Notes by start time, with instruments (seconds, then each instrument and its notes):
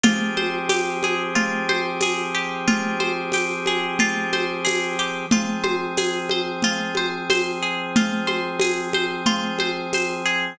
0.03 drawbar organ F3 C4 G4 G#4, pizzicato strings F4, low conga
0.37 pizzicato strings C5, high conga
0.69 pizzicato strings G4, tambourine, high conga
1.03 pizzicato strings G#4, high conga
1.35 pizzicato strings F4, low conga
1.69 pizzicato strings C5, high conga
2.01 pizzicato strings G#4, tambourine, high conga
2.35 pizzicato strings G4
2.68 pizzicato strings F4, low conga
3.00 pizzicato strings C5, high conga
3.32 pizzicato strings G4, tambourine, high conga
3.66 pizzicato strings G#4, high conga
3.99 pizzicato strings F4, low conga
4.33 pizzicato strings C5, high conga
4.65 pizzicato strings G#4, tambourine, high conga
4.99 pizzicato strings G4
5.31 drawbar organ F3 C4 G#4, pizzicato strings F4, low conga
5.64 pizzicato strings C5, high conga
5.97 pizzicato strings G#4, tambourine, high conga
6.29 pizzicato strings C5, high conga
6.62 pizzicato strings F4, low conga
6.95 pizzicato strings C5, high conga
7.30 pizzicato strings C5, tambourine, high conga
7.63 pizzicato strings G#4
7.96 pizzicato strings F4, low conga
8.27 pizzicato strings C5, high conga
8.60 pizzicato strings G#4, tambourine, high conga
8.93 pizzicato strings C5, high conga
9.26 pizzicato strings F4, low conga
9.59 pizzicato strings C5, high conga
9.93 pizzicato strings C5, tambourine, high conga
10.26 pizzicato strings G#4